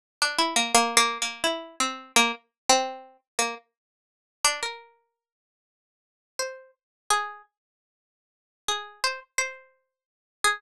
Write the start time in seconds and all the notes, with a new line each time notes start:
0.22 D4
0.39 E4
0.56 A#3
0.75 A#3
0.97 A#3
1.22 A#3
1.44 E4
1.80 C4
2.16 A#3
2.69 C4
3.39 A#3
4.45 D4
4.63 A#4
6.39 C5
7.10 G#4
8.68 G#4
9.04 C5
9.38 C5
10.44 G#4